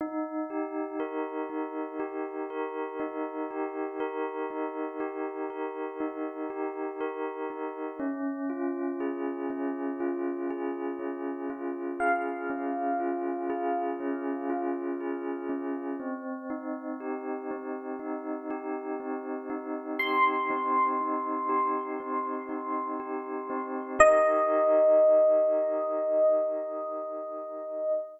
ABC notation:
X:1
M:4/4
L:1/8
Q:1/4=60
K:Ebmix
V:1 name="Electric Piano 1"
z8 | z8 | z8 | f8 |
z8 | c'8 | e8 |]
V:2 name="Tubular Bells"
E G B E G B E G | B E G B E G B E | D F A D F A D F | A D F A D F A D |
C E G C E G C E | G C E G C E G C | [EGB]8 |]